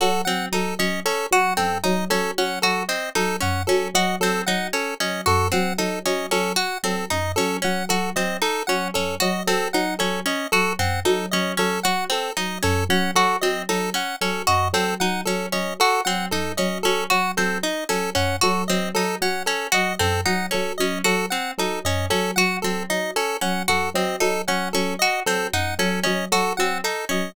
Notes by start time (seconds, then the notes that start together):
0.00 F#3 F#4 A4
0.25 F#3 C4 F#5
0.52 F#3 D#4 A4
0.79 F#3 C#4 D#5
1.05 C#4 A4
1.31 F#3 F#4 F#5
1.57 F#2 C4 A4
1.84 F#3 D#4 D#5
2.10 F#3 C#4 A4
2.38 F#3 C#4 F#5
2.62 F#3 F#4 A4
2.89 C4 D#5
3.15 F#3 D#4 A4
3.40 F#2 C#4 F#5
3.67 F#3 C#4 A4
3.94 F#3 F#4 D#5
4.20 F#3 C4 A4
4.46 F#3 D#4 F#5
4.73 C#4 A4
5.00 F#3 C#4 D#5
5.26 F#2 F#4 A4
5.52 F#3 C4 F#5
5.78 F#3 D#4 A4
6.05 F#3 C#4 D#5
6.31 F#3 C#4 A4
6.56 F#4 F#5
6.83 F#3 C4 A4
7.10 F#2 D#4 D#5
7.36 F#3 C#4 A4
7.62 F#3 C#4 F#5
7.89 F#3 F#4 A4
8.16 F#3 C4 D#5
8.42 D#4 A4
8.67 F#3 C#4 F#5
8.94 F#2 C#4 A4
9.20 F#3 F#4 D#5
9.47 F#3 C4 A4
9.73 F#3 D#4 F#5
9.99 F#3 C#4 A4
10.26 C#4 D#5
10.52 F#3 F#4 A4
10.79 F#2 C4 F#5
11.05 F#3 D#4 A4
11.31 F#3 C#4 D#5
11.57 F#3 C#4 A4
11.83 F#3 F#4 F#5
12.10 C4 A4
12.37 F#3 D#4 D#5
12.63 F#2 C#4 A4
12.89 F#3 C#4 F#5
13.15 F#3 F#4 A4
13.41 F#3 C4 D#5
13.69 F#3 D#4 A4
13.94 C#4 F#5
14.21 F#3 C#4 A4
14.47 F#2 F#4 D#5
14.73 F#3 C4 A4
15.00 F#3 D#4 F#5
15.25 F#3 C#4 A4
15.52 F#3 C#4 D#5
15.80 F#4 A4
16.05 F#3 C4 F#5
16.31 F#2 D#4 A4
16.57 F#3 C#4 D#5
16.83 F#3 C#4 A4
17.10 F#3 F#4 F#5
17.37 F#3 C4 A4
17.63 D#4 D#5
17.89 F#3 C#4 A4
18.15 F#2 C#4 F#5
18.41 F#3 F#4 A4
18.68 F#3 C4 D#5
18.94 F#3 D#4 A4
19.21 F#3 C#4 F#5
19.46 C#4 A4
19.72 F#3 F#4 D#5
19.99 F#2 C4 A4
20.25 F#3 D#4 F#5
20.51 F#3 C#4 A4
20.78 F#3 C#4 D#5
21.04 F#3 F#4 A4
21.30 C4 F#5
21.58 F#3 D#4 A4
21.84 F#2 C#4 D#5
22.10 F#3 C#4 A4
22.36 F#3 F#4 F#5
22.62 F#3 C4 A4
22.90 F#3 D#4 D#5
23.16 C#4 A4
23.41 F#3 C#4 F#5
23.68 F#2 F#4 A4
23.94 F#3 C4 D#5
24.20 F#3 D#4 A4
24.48 F#3 C#4 F#5
24.73 F#3 C#4 A4
24.99 F#4 D#5
25.26 F#3 C4 A4
25.53 F#2 D#4 F#5
25.79 F#3 C#4 A4
26.04 F#3 C#4 D#5
26.32 F#3 F#4 A4
26.57 F#3 C4 F#5
26.84 D#4 A4
27.09 F#3 C#4 D#5